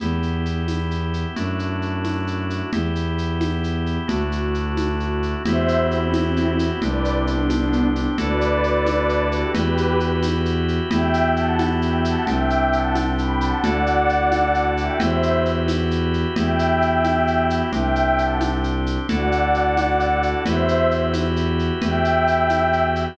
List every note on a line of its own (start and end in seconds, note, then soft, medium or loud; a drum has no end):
0.00 1.25 E2 medium
0.00 1.35 B3 medium
0.00 1.35 E4 medium
0.00 1.35 G4 medium
0.00 low conga medium
0.00 shaker medium
0.23 shaker soft
0.45 shaker medium
0.68 tambourine medium
0.68 high conga medium
0.68 shaker medium
0.91 shaker medium
1.14 shaker medium
1.36 2.62 F#2 medium
1.36 2.71 A3 medium
1.36 2.71 D4 medium
1.36 2.71 E4 medium
1.36 2.71 F#4 medium
1.36 low conga medium
1.36 shaker medium
1.59 shaker medium
1.82 shaker soft
2.05 tambourine medium
2.05 high conga medium
2.05 shaker soft
2.27 shaker medium
2.50 shaker medium
2.73 3.98 E2 medium
2.73 4.08 B3 medium
2.73 4.07 E4 medium
2.73 4.08 G4 medium
2.73 low conga medium
2.73 shaker medium
2.95 shaker medium
3.18 shaker medium
3.41 tambourine medium
3.41 high conga medium
3.41 shaker medium
3.64 shaker medium
3.86 shaker soft
4.08 5.35 D2 medium
4.08 5.43 A3 medium
4.08 5.43 D4 medium
4.08 5.43 E4 medium
4.08 5.43 F#4 medium
4.08 low conga medium
4.08 shaker medium
4.32 shaker medium
4.54 shaker soft
4.77 tambourine medium
4.77 high conga medium
4.77 shaker medium
5.00 shaker soft
5.23 shaker soft
5.45 6.71 E2 loud
5.45 6.80 B3 medium
5.45 6.80 E4 medium
5.45 6.80 F#4 medium
5.45 6.80 G4 medium
5.45 5.79 C5 medium
5.45 5.79 E5 loud
5.45 low conga medium
5.45 shaker medium
5.68 shaker medium
5.80 5.91 E4 medium
5.80 5.91 G4 medium
5.91 6.11 C4 medium
5.91 6.11 E4 medium
5.91 shaker medium
6.13 6.51 C4 medium
6.13 6.51 E4 medium
6.13 tambourine medium
6.13 high conga medium
6.13 shaker medium
6.36 shaker medium
6.59 shaker medium
6.82 8.07 C2 loud
6.82 8.17 C4 medium
6.82 8.17 D4 medium
6.82 8.17 G4 medium
6.82 7.13 B4 medium
6.82 7.13 D5 medium
6.82 low conga medium
6.82 shaker medium
7.05 shaker medium
7.15 7.26 C4 medium
7.15 7.26 E4 medium
7.27 7.46 B3 medium
7.27 7.46 D4 medium
7.27 shaker medium
7.49 7.86 B3 medium
7.49 7.86 D4 medium
7.49 tambourine medium
7.49 high conga medium
7.49 shaker medium
7.73 shaker medium
7.96 shaker medium
8.18 9.44 D2 loud
8.18 9.53 D4 medium
8.18 9.53 E4 medium
8.18 9.53 F#4 medium
8.18 9.53 A4 medium
8.18 9.24 B4 medium
8.18 9.24 D5 loud
8.18 low conga medium
8.18 shaker medium
8.41 shaker medium
8.64 shaker medium
8.86 tambourine medium
8.86 high conga medium
8.86 shaker medium
9.09 shaker medium
9.32 9.52 G4 medium
9.32 9.52 B4 medium
9.32 shaker medium
9.54 10.80 E2 loud
9.54 10.90 E4 medium
9.54 10.90 F#4 medium
9.54 9.98 G4 medium
9.54 10.90 G4 medium
9.54 9.98 B4 medium
9.54 10.90 B4 medium
9.54 low conga medium
9.54 shaker medium
9.77 shaker medium
10.00 shaker medium
10.23 tambourine medium
10.23 high conga medium
10.23 shaker medium
10.45 shaker medium
10.68 shaker soft
10.90 12.16 E2 loud
10.90 12.25 B3 medium
10.90 12.25 E4 medium
10.90 12.25 F#4 medium
10.90 12.25 G4 medium
10.90 11.28 E5 medium
10.90 11.28 G5 loud
10.90 low conga medium
10.90 shaker medium
11.14 shaker medium
11.36 11.59 F#5 medium
11.36 11.59 A5 medium
11.36 shaker medium
11.59 tambourine medium
11.59 high conga medium
11.59 shaker medium
11.82 12.00 E5 medium
11.82 12.00 G5 medium
11.82 shaker medium
12.05 12.26 F#5 medium
12.05 12.26 A5 medium
12.05 shaker medium
12.27 13.53 C2 loud
12.27 13.62 C4 medium
12.27 13.62 D4 medium
12.27 13.62 G4 medium
12.27 12.69 E5 medium
12.27 12.69 G5 medium
12.27 low conga medium
12.27 shaker medium
12.50 shaker medium
12.73 12.94 F#5 medium
12.73 12.94 A5 medium
12.73 shaker medium
12.95 tambourine medium
12.95 high conga medium
12.95 shaker medium
13.18 13.40 G5 medium
13.18 13.40 B5 medium
13.18 shaker medium
13.41 13.59 F#5 medium
13.41 13.59 A5 medium
13.41 shaker medium
13.63 14.89 D2 loud
13.63 14.98 D4 medium
13.63 14.98 E4 medium
13.63 14.98 F#4 medium
13.63 14.98 A4 medium
13.63 14.61 D5 medium
13.63 14.61 F#5 loud
13.63 low conga medium
13.63 shaker medium
13.86 shaker medium
14.09 shaker medium
14.32 tambourine medium
14.32 high conga medium
14.32 shaker medium
14.54 shaker medium
14.77 14.98 E5 medium
14.77 14.98 G5 medium
14.77 shaker medium
14.99 16.25 E2 loud
14.99 16.35 E4 medium
14.99 16.35 F#4 medium
14.99 16.35 G4 medium
14.99 16.35 B4 medium
14.99 15.36 C5 medium
14.99 15.36 E5 medium
14.99 low conga medium
14.99 shaker medium
15.23 shaker medium
15.45 shaker medium
15.68 tambourine medium
15.68 high conga medium
15.68 shaker medium
15.91 shaker medium
16.14 shaker soft
16.36 17.62 E2 loud
16.36 17.72 B3 medium
16.36 17.72 E4 medium
16.36 17.72 F#4 medium
16.36 17.72 G4 medium
16.36 17.46 E5 medium
16.36 17.46 G5 medium
16.36 low conga medium
16.36 shaker medium
16.59 shaker medium
16.82 shaker medium
17.04 tambourine medium
17.04 high conga medium
17.04 shaker medium
17.27 shaker medium
17.50 shaker medium
17.72 18.98 C2 loud
17.72 19.07 C4 medium
17.72 19.07 D4 medium
17.72 19.07 G4 medium
17.72 18.15 E5 medium
17.72 18.15 G5 loud
17.72 low conga medium
17.72 shaker medium
17.95 shaker medium
18.17 18.39 F#5 medium
18.17 18.39 A5 medium
18.17 shaker medium
18.41 tambourine medium
18.41 high conga medium
18.41 shaker medium
18.64 shaker medium
18.86 shaker medium
19.09 20.34 D2 loud
19.09 20.44 D4 medium
19.09 20.44 E4 medium
19.09 20.44 F#4 medium
19.09 20.44 A4 medium
19.09 20.21 D5 medium
19.09 20.21 F#5 medium
19.09 low conga medium
19.09 shaker medium
19.32 shaker medium
19.54 shaker medium
19.77 tambourine medium
19.77 high conga medium
19.77 shaker medium
20.00 shaker medium
20.23 shaker medium
20.46 21.71 E2 loud
20.46 21.81 E4 medium
20.46 21.81 F#4 medium
20.46 21.81 G4 medium
20.46 21.81 B4 medium
20.46 20.87 C5 medium
20.46 20.87 E5 loud
20.46 low conga medium
20.46 shaker medium
20.68 shaker medium
20.91 shaker medium
21.14 tambourine medium
21.14 high conga medium
21.14 shaker medium
21.36 shaker medium
21.59 shaker soft
21.82 23.08 E2 medium
21.82 23.17 E4 medium
21.82 23.17 F#4 medium
21.82 23.17 G4 medium
21.82 23.17 B4 medium
21.82 22.82 E5 medium
21.82 22.82 G5 loud
21.82 low conga medium
21.82 shaker medium
22.05 shaker medium
22.27 shaker medium
22.50 tambourine medium
22.50 high conga medium
22.50 shaker medium
22.73 shaker medium
22.96 shaker medium